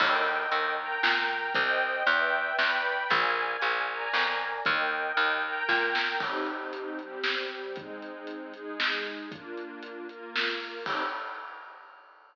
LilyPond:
<<
  \new Staff \with { instrumentName = "String Ensemble 1" } { \time 3/4 \key ees \major \tempo 4 = 116 <bes' ees'' g''>4. <bes' g'' bes''>4. | <c'' ees'' g''>4 <b' d'' e'' g''>4 <b' d'' g'' b''>4 | <bes' d'' f'' aes''>4. <bes' d'' aes'' bes''>4. | <bes' ees'' g''>4. <bes' g'' bes''>4. |
\key c \minor <c' ees' g'>4. <g c' g'>4. | <aes c' ees'>4. <aes ees' aes'>4. | <bes d' f'>4. <bes f' bes'>4. | <c' ees' g'>4 r2 | }
  \new Staff \with { instrumentName = "Electric Bass (finger)" } { \clef bass \time 3/4 \key ees \major ees,4 ees,4 bes,4 | c,4 e,4 e,4 | bes,,4 bes,,4 f,4 | ees,4 ees,4 bes,4 |
\key c \minor r2. | r2. | r2. | r2. | }
  \new DrumStaff \with { instrumentName = "Drums" } \drummode { \time 3/4 <cymc bd>4 hh4 sn4 | <hh bd>4 hh4 sn4 | <hh bd>4 hh4 sn4 | <hh bd>4 hh4 <bd sn>8 sn8 |
<cymc bd>8 hh8 hh8 hh8 sn8 hh8 | <hh bd>8 hh8 hh8 hh8 sn8 hh8 | <hh bd>8 hh8 hh8 hh8 sn8 hho8 | <cymc bd>4 r4 r4 | }
>>